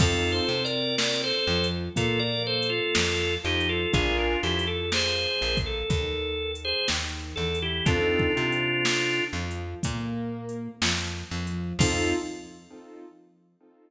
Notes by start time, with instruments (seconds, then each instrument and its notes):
0.00 electric bass (finger) F2, acoustic grand piano C4 D#4 F4 A4, drawbar organ F4 A4, kick, crash
0.32 drawbar organ A4 C5
0.49 electric bass (finger) C3, acoustic grand piano C4
0.65 drawbar organ A#4 D5, closed hi-hat
0.98 drawbar organ A#4 D5, snare
1.24 drawbar organ A4 C5
1.47 electric bass (finger) F2, acoustic grand piano F3
1.64 closed hi-hat
1.96 electric bass (finger) A#2, acoustic grand piano A#3, drawbar organ F4 A4, kick, closed hi-hat
2.19 drawbar organ A#4 D5
2.47 drawbar organ A4 C5
2.63 closed hi-hat
2.69 drawbar organ F4 A4
2.95 electric bass (finger) F2, acoustic grand piano F3, snare
3.44 electric bass (finger) F2, acoustic grand piano F3, drawbar organ D#4 G4
3.60 closed hi-hat
3.69 drawbar organ F4 A4
3.93 electric bass (finger) A#1, acoustic grand piano D4 F4 G#4 A#4, drawbar organ F4 G#4, kick, closed hi-hat
4.18 drawbar organ D4 F4
4.43 electric bass (finger) F2, acoustic grand piano F3, drawbar organ E4 G4
4.59 closed hi-hat
4.67 drawbar organ A4
4.92 drawbar organ G#4 C5, snare
5.41 electric bass (finger) A#1, acoustic grand piano A#3
5.57 kick, closed hi-hat
5.66 drawbar organ A4
5.90 electric bass (finger) D#2, acoustic grand piano D#3, kick, closed hi-hat
6.55 closed hi-hat
6.65 drawbar organ G#4 C5
6.88 electric bass (finger) D#2, acoustic grand piano D#3, snare
7.36 electric bass (finger) E2, acoustic grand piano E3, drawbar organ A4
7.55 closed hi-hat
7.62 drawbar organ E4 G4
7.86 electric bass (finger) F2, acoustic grand piano C4 D#4 F4 A4, drawbar organ D4 F4, kick, closed hi-hat
8.19 kick
8.36 electric bass (finger) C3, acoustic grand piano C4
8.52 closed hi-hat
8.85 snare
9.33 electric bass (finger) F2, acoustic grand piano F3
9.51 closed hi-hat
9.83 electric bass (finger) A#2, acoustic grand piano A#3, kick, closed hi-hat
10.49 closed hi-hat
10.82 electric bass (finger) F2, acoustic grand piano F3, snare
11.31 electric bass (finger) F2, acoustic grand piano F3
11.47 closed hi-hat
11.79 electric bass (finger) F2, acoustic grand piano C4 D#4 F4 A4, drawbar organ F4, kick, crash